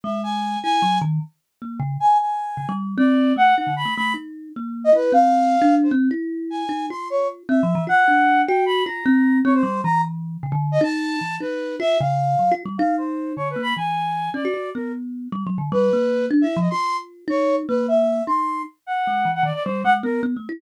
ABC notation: X:1
M:5/8
L:1/16
Q:1/4=153
K:none
V:1 name="Flute"
e2 ^g4 g4 | z10 | ^g2 g6 z2 | d4 ^f2 f2 b2 |
b2 z7 ^d | B2 f7 c | z6 ^g4 | c'2 ^c2 z2 e4 |
^f6 g2 b2 | ^a6 ^c =c3 | ^a2 z7 ^d | a6 B4 |
e2 f6 z2 | f2 c4 (3^c2 B2 b2 | ^g6 d4 | ^A2 z8 |
B6 z e2 ^d | c'3 z3 ^c3 z | B2 e4 c'4 | z2 ^f5 f d d |
c2 ^f z ^A2 z4 |]
V:2 name="Kalimba"
^G,6 E2 ^F,2 | ^D,2 z4 ^A,2 ^C,2 | z6 ^C, G,3 | C4 A,2 ^D =D,2 A, |
A,2 ^D4 ^A,4 | E2 C5 D3 | C2 E6 ^D2 | F6 (3C2 F,2 E,2 |
F2 D4 ^F4 | F2 C4 C2 G,2 | E,6 ^C, D,3 | ^D4 E,2 D4 |
F2 ^C,4 (3^F,2 =F2 G,2 | ^D6 =D,2 ^A,2 | E,6 ^C ^F F2 | B,6 (3G,2 ^F,2 D,2 |
G,2 ^A,4 (3D2 E2 F,2 | F6 ^D4 | ^A,6 ^D4 | z4 ^G,2 E,2 ^D, z |
G,2 ^G,2 B,2 (3B,2 A,2 E2 |]